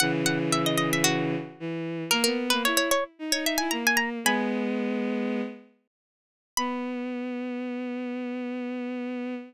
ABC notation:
X:1
M:4/4
L:1/16
Q:1/4=113
K:B
V:1 name="Harpsichord"
f z f z e d d e F6 z2 | A A2 B c c c z2 c e g a g a z | "^rit." [gb]4 z12 | b16 |]
V:2 name="Violin"
[C,E,]12 E,4 | A, B,2 A, E2 z2 D D2 E A,4 | "^rit." [G,B,]10 z6 | B,16 |]